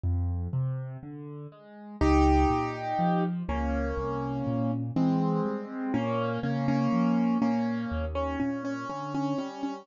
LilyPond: <<
  \new Staff \with { instrumentName = "Acoustic Grand Piano" } { \time 4/4 \key f \minor \partial 2 \tempo 4 = 61 r2 | <ees' g'>4. <bes des'>4. <aes c'>4 | <bes des'>8 <bes des'>16 <bes des'>8. <bes des'>8. des'16 des'16 des'16 des'16 des'16 des'16 des'16 | }
  \new Staff \with { instrumentName = "Acoustic Grand Piano" } { \clef bass \time 4/4 \key f \minor \partial 2 f,8 c8 d8 aes8 | des,8 bes,8 f8 des,8 c,8 bes,8 e8 g8 | bes,8 des8 f8 bes,8 ees,8 bes,8 d8 g8 | }
>>